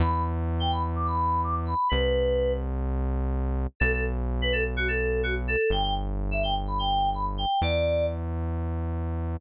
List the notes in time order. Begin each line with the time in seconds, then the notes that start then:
0.00 E2 B5
0.11 B5
0.60 G5
0.71 B5
0.95 D6
1.07 B5
1.44 D6
1.66 B5
1.89 C2 B4
3.80 B1 A4
3.93 A4
4.42 B4
4.52 A4
4.77 F#4
4.88 A4
5.23 F#4
5.48 A4
5.70 G1 G5
5.83 G5
6.31 E5
6.43 G5
6.67 B5
6.79 G5
7.14 B5
7.38 G5
7.62 E2 D5